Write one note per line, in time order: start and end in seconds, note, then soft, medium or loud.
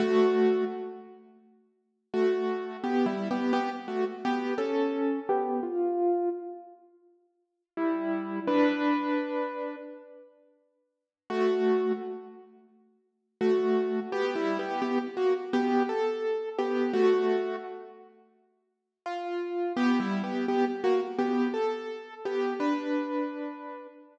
0.00 0.64 A3 loud
0.00 0.64 F#4 loud
2.14 2.77 A3 medium
2.14 2.77 F#4 loud
2.84 3.06 B3 medium
2.84 3.06 G4 loud
3.06 3.28 G3 medium
3.06 3.28 E4 medium
3.31 3.52 B3 medium
3.31 3.52 G4 loud
3.53 3.70 B3 loud
3.53 3.70 G4 loud
3.88 4.05 A3 medium
3.88 4.05 F#4 medium
4.25 4.54 B3 medium
4.25 4.54 G4 loud
4.58 5.19 C#4 medium
4.58 5.19 A4 medium
5.29 5.60 B3 medium
5.29 5.60 G4 loud
5.63 6.29 F4 loud
7.77 8.40 G3 medium
7.77 8.40 E4 loud
8.47 9.76 D4 loud
8.47 9.76 B4 loud
11.30 11.92 A3 loud
11.30 11.92 F#4 loud
13.41 14.00 A3 medium
13.41 14.00 F#4 loud
14.12 14.35 B3 loud
14.12 14.35 G4 loud
14.35 14.58 G3 loud
14.35 14.58 E4 loud
14.59 14.81 B3 medium
14.59 14.81 G4 loud
14.82 14.98 B3 loud
14.82 14.98 G4 loud
15.17 15.34 A#3 medium
15.17 15.34 F#4 loud
15.53 15.83 B3 loud
15.53 15.83 G4 loud
15.89 16.49 A4 loud
16.59 16.92 B3 medium
16.59 16.92 G4 loud
16.93 17.56 A3 loud
16.93 17.56 F#4 loud
19.06 19.73 F4 medium
19.76 19.99 B3 loud
19.76 19.99 G4 loud
20.00 20.22 G3 medium
20.00 20.22 E4 loud
20.24 20.46 B3 medium
20.24 20.46 G4 medium
20.48 20.65 B3 medium
20.48 20.65 G4 loud
20.84 21.00 A#3 medium
20.84 21.00 F#4 loud
21.19 21.48 B3 medium
21.19 21.48 G4 loud
21.54 22.14 A4 loud
22.25 22.54 B3 medium
22.25 22.54 G4 loud
22.60 23.87 D4 medium
22.60 23.87 B4 medium